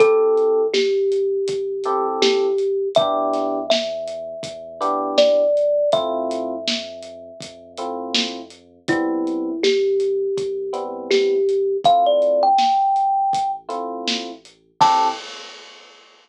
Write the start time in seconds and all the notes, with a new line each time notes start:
0.00 A1 C4 E4 G4 A4, kick, closed hi-hat
0.38 closed hi-hat
0.74 G4, snare
1.12 closed hi-hat
1.48 A1, kick, closed hi-hat
1.84 C4 E4 G4 A4, closed hi-hat
2.22 G4, snare
2.58 closed hi-hat
2.95 E2 B3 D4 E4 G4 E5, kick, closed hi-hat
3.33 snare, closed hi-hat
3.70 E5, snare
4.08 closed hi-hat
4.43 E2, kick, closed hi-hat
4.81 B3 D4 E4 G4, closed hi-hat
5.18 D5, snare
5.57 closed hi-hat
5.92 F2 A3 C4 E4 F4 E5, kick, closed hi-hat
6.31 closed hi-hat
6.68 snare
7.03 closed hi-hat
7.41 F2, kick, closed hi-hat
7.77 A3 C4 E4 F4, closed hi-hat
8.15 snare
8.50 closed hi-hat
8.88 C2 G3 B3 C4 E4, kick, closed hi-hat
9.27 closed hi-hat
9.63 G4, snare
10.00 closed hi-hat
10.37 C2, kick, closed hi-hat
10.73 G3 B3 C4 E4, closed hi-hat
11.10 G4, snare
11.49 closed hi-hat
11.84 A1 A3 C4 E4 F4 F5, kick, closed hi-hat
12.06 D5
12.22 closed hi-hat
12.43 G5
12.58 snare
12.96 closed hi-hat
13.33 A1, kick, closed hi-hat
13.69 A3 C4 E4 F4, closed hi-hat
14.08 snare
14.45 closed hi-hat
14.81 A2 C4 E4 G4 A4 A5, kick, crash